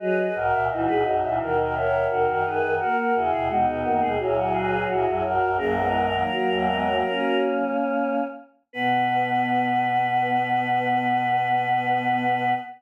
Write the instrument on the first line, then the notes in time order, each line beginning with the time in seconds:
choir aahs
0.00 F#3 G#4 B4 D#5
0.17 G#4 B4 D#5
0.35 B1 G#2 F#4 A#4 D#5
0.52 C#2 A#2 E5
0.69 C#2 A#2 E3 D#4 F#4 D#5
0.87 C#2 A#2 G#3 B4
1.05 A#1 F#2 F#3 D#5
1.22 C#2 A#2 E3 E5
1.40 D#2 B2 D#3 F#4 A#4
1.56 F#4 A#4 D#5
1.74 A#4 C#5 E5
1.92 E5
2.09 D#2 B2 F#4 A#4
2.27 F#2 D#3 F#4 A#4
2.44 F#2 D#3 G#4 B4
2.62 F#2 D#3
2.79 A#3 F#4 A#4
2.97 F#4 A#4
3.14 E2 C#3 E4 F#4 G#4
3.31 D#2 B2 G#4
3.48 D#2 B2 G#3 B3 D#4 F#4
3.66 D#2 B2 B3 F#4
3.84 F#2 D#3 A#3 F#4
4.01 D#2 B2 G#3 G#4
4.19 C#2 A#2 F#3 E4 G#4
4.36 E4 F#4 G#4
4.52 G#4 B4
4.71 G#4
4.88 C#2 A#2 E4 F#4 G#4
5.05 A#1 F#2 E4 G#4
5.23 A#1 F#2 F#4 A#4
5.41 A#1 F#2
5.56 A#1 F#2 C#3 F#3 A#3 A#4
5.76 E3 G#3 B3
5.93 D#3
6.11 D#3 F#3 A#3
6.30 F#3 A#3
6.48 G#1 E2 F#3 A#3
6.67 G#3 B3
6.86 F#3 A#3
7.06 A#3 C#4
8.73 B2 B3 B4